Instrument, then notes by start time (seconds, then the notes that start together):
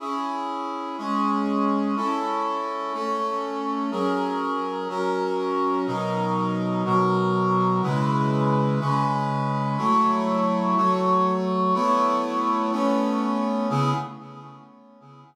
brass section
0.00 C#4 E4 G#4
0.98 G#3 C#4 G#4
1.96 C#4 E4 A4
2.93 A3 C#4 A4
3.91 F#3 C#4 G#4 A#4
4.89 F#3 C#4 F#4 A#4
5.87 B2 F#3 D#4 A#4
6.85 B2 F#3 F#4 A#4
7.82 C#3 G#3 E4 B4
8.80 C#3 G#3 C#4 B4
9.78 F#3 A3 E4 C#5
10.76 F#3 A3 F#4 C#5
11.74 A3 B3 E4 C#5
12.72 A3 B3 C#4 C#5
13.70 C#3 B3 E4 G#4